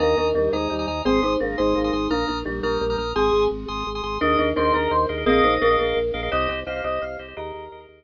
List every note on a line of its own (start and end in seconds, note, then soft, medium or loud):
0.00 0.15 D#2 loud
0.00 0.16 A#3 medium
0.00 0.17 D4 medium
0.00 0.17 A#4 medium
0.00 0.28 G#5 medium
0.00 0.28 A#5 medium
0.00 0.28 D#6 medium
0.18 0.33 D#2 medium
0.18 0.34 D4 medium
0.18 0.34 A#4 medium
0.34 0.49 D#2 medium
0.34 0.52 G3 medium
0.34 0.52 D4 medium
0.34 0.52 A#4 medium
0.52 0.68 D#2 medium
0.52 0.69 G#3 medium
0.52 0.99 D#4 medium
0.52 0.99 C5 medium
0.52 0.74 G#5 medium
0.52 0.74 A#5 medium
0.52 0.74 D#6 medium
0.70 0.86 D#2 medium
0.70 0.85 G3 medium
0.79 0.86 G#5 medium
0.79 0.86 A#5 medium
0.79 0.86 D#6 medium
0.87 1.02 D#2 medium
0.87 1.02 G#5 medium
0.87 1.02 A#5 medium
0.87 1.02 D#6 medium
1.05 1.20 G#1 loud
1.05 1.21 C4 loud
1.05 1.21 C4 medium
1.05 1.21 G#4 medium
1.05 1.34 G#5 medium
1.05 1.34 C6 loud
1.05 1.34 D#6 medium
1.22 1.37 G#1 medium
1.22 1.40 D#4 medium
1.22 1.40 C5 medium
1.40 1.56 G#1 medium
1.40 1.56 A#3 medium
1.40 1.56 D4 medium
1.40 1.56 A#4 medium
1.58 1.74 G#1 loud
1.58 1.76 G#3 medium
1.58 2.09 D#4 medium
1.58 2.09 C5 medium
1.58 1.79 G#5 medium
1.58 1.79 C6 medium
1.58 1.79 D#6 medium
1.75 1.91 G#1 medium
1.75 1.91 A#3 medium
1.84 1.91 G#5 medium
1.84 1.91 C6 medium
1.84 1.91 D#6 medium
1.93 2.08 G#1 medium
1.93 2.07 G#5 medium
1.93 2.07 C6 medium
1.93 2.07 D#6 medium
2.10 2.25 A#1 medium
2.10 2.25 A#3 medium
2.10 2.27 D4 medium
2.10 2.27 A#4 medium
2.10 2.39 A#5 medium
2.10 2.39 D#6 medium
2.10 2.39 F6 medium
2.28 2.44 A#1 medium
2.28 2.42 D4 medium
2.28 2.42 A#4 medium
2.45 2.61 A#1 medium
2.45 2.59 G3 medium
2.45 2.60 D4 medium
2.45 2.60 A#4 medium
2.63 2.78 A#1 medium
2.63 2.78 G3 medium
2.63 3.06 D4 medium
2.63 3.06 A#4 medium
2.63 2.84 A#5 medium
2.63 2.84 D#6 medium
2.63 2.84 F6 medium
2.81 2.96 A#1 loud
2.81 2.96 G3 medium
2.90 2.97 A#5 medium
2.90 2.97 D#6 medium
2.90 2.97 F6 medium
2.98 3.13 A#1 medium
2.98 3.12 A#5 medium
2.98 3.12 D#6 medium
2.98 3.12 F6 medium
3.15 3.31 G#1 loud
3.15 3.84 C4 medium
3.15 3.45 G#4 medium
3.15 3.84 G#4 medium
3.15 3.44 G#5 medium
3.15 3.44 C6 medium
3.15 3.44 D#6 medium
3.33 3.48 G#1 medium
3.51 3.66 G#1 medium
3.68 3.84 G#1 medium
3.68 3.89 G#5 medium
3.68 3.89 C6 medium
3.68 3.89 D#6 medium
3.87 4.02 G#1 medium
3.95 4.02 G#5 medium
3.95 4.02 C6 medium
3.95 4.02 D#6 medium
4.03 4.18 G#1 medium
4.03 4.17 G#5 medium
4.03 4.17 C6 medium
4.03 4.17 D#6 medium
4.21 4.37 D#2 loud
4.21 4.37 D4 medium
4.21 4.49 G#4 medium
4.21 4.49 A#4 loud
4.21 4.37 A#4 medium
4.21 4.49 D#5 medium
4.21 4.36 D#5 medium
4.39 4.54 D#2 medium
4.39 4.54 D4 medium
4.39 4.54 A#4 medium
4.56 4.72 D#2 loud
4.56 4.73 D4 medium
4.56 4.63 G#4 medium
4.56 4.73 A#4 medium
4.56 4.63 A#4 medium
4.56 4.73 C5 medium
4.56 4.63 D#5 medium
4.65 4.93 G#4 medium
4.65 4.93 A#4 medium
4.65 4.93 D#5 medium
4.73 4.88 D#2 medium
4.73 5.20 D4 medium
4.73 5.20 A#4 medium
4.73 4.89 A#4 medium
4.91 5.06 D#2 loud
4.91 5.06 C5 medium
5.09 5.25 D#2 medium
5.09 5.16 G#4 medium
5.09 5.16 A#4 medium
5.09 5.16 D#5 medium
5.17 5.24 G#4 medium
5.17 5.24 A#4 medium
5.17 5.24 D#5 medium
5.26 5.41 A#1 loud
5.26 5.42 C4 medium
5.26 5.54 G#4 loud
5.26 5.42 G#4 medium
5.26 5.54 A#4 loud
5.26 5.76 D#5 loud
5.26 5.54 D#5 medium
5.26 5.54 F5 loud
5.44 5.59 A#1 medium
5.44 5.61 D#4 medium
5.44 5.61 C5 medium
5.61 5.77 A#1 medium
5.61 5.76 D4 medium
5.61 5.68 G#4 medium
5.61 5.76 A#4 medium
5.61 5.68 A#4 medium
5.61 5.68 D#5 medium
5.61 5.68 F5 medium
5.71 5.99 G#4 medium
5.71 5.99 A#4 medium
5.71 5.99 D#5 medium
5.71 5.99 F5 medium
5.79 5.94 A#1 medium
5.79 6.28 D4 soft
5.79 6.28 A#4 medium
5.96 6.11 A#1 medium
6.14 6.29 A#1 medium
6.14 6.21 G#4 medium
6.14 6.21 A#4 medium
6.14 6.21 D#5 medium
6.14 6.21 F5 medium
6.23 6.30 G#4 medium
6.23 6.30 A#4 medium
6.23 6.30 D#5 medium
6.23 6.30 F5 medium
6.32 6.48 C2 loud
6.32 6.47 G4 medium
6.32 6.60 G4 loud
6.32 6.60 C5 loud
6.32 6.47 D#5 medium
6.32 6.60 D#5 loud
6.32 6.48 D#5 medium
6.49 6.64 C2 medium
6.49 6.64 G4 medium
6.49 6.64 D#5 medium
6.67 6.82 C2 medium
6.67 6.81 G4 medium
6.67 6.74 G4 medium
6.67 6.74 C5 medium
6.67 6.81 D#5 medium
6.67 6.74 D#5 medium
6.67 6.83 F5 medium
6.76 7.04 G4 medium
6.76 7.04 C5 medium
6.76 7.04 D#5 medium
6.84 6.99 C2 loud
6.84 7.28 G4 medium
6.84 7.01 D#5 medium
6.84 7.28 D#5 medium
7.02 7.17 C2 medium
7.02 7.17 F5 medium
7.19 7.34 C2 medium
7.19 7.26 G4 medium
7.19 7.26 C5 medium
7.19 7.26 D#5 medium
7.28 7.35 G4 medium
7.28 7.35 C5 medium
7.28 7.35 D#5 medium
7.37 7.52 D#2 loud
7.37 8.04 G4 medium
7.37 7.65 G#4 loud
7.37 7.65 A#4 medium
7.37 7.82 A#4 medium
7.37 7.65 D#5 medium
7.37 8.04 D#5 medium
7.54 7.69 D#2 loud
7.72 7.87 D#2 medium
7.72 7.79 G#4 medium
7.72 7.79 A#4 medium
7.72 7.79 D#5 medium
7.80 8.04 G#4 medium
7.80 8.04 A#4 medium
7.80 8.04 D#5 medium
7.89 8.04 D#2 medium